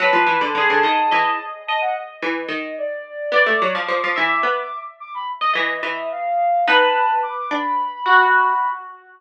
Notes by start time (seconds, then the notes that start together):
0.00 F#3 B4 A5
0.13 F3
0.27 E3
0.41 D3
0.55 D3 G#4
0.70 D3
0.83 D#3 D#5
1.11 E3 D#5
1.67 D#5 A5
1.81 F#5
2.22 E3
2.48 D#3 D#5
2.78 D5
3.32 B3 D5 D6
3.46 A3
3.62 F#3
3.75 F3
3.88 F3
4.04 F3
4.16 E3 E5
4.43 B3
5.00 D6
5.14 B5
5.41 D#5
5.53 E3 D#5
5.83 E3 E5
6.11 F5
6.66 B3 D#4 B4 A5
7.22 D6
7.50 D4 B5
8.06 F#4